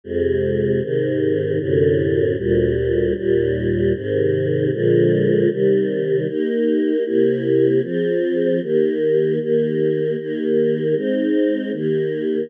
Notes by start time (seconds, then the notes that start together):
0.04 F2 C3 G#3
0.81 G#2 C3 D#3
1.59 F#2 A2 C3 D3
2.37 D2 A#2 G3
3.15 D#2 A#2 G3
3.94 G#2 C3 D#3
4.72 A#2 D3 F3 G#3
5.50 C3 D#3 G3
6.27 A#3 D#4 G4
7.04 C3 A#3 E4 G4
7.83 F3 C4 G#4
8.62 D#3 A#3 G4
9.39 D#3 A#3 G4
10.18 D#3 A#3 G4
10.94 G#3 C4 D#4
11.72 D#3 A#3 G4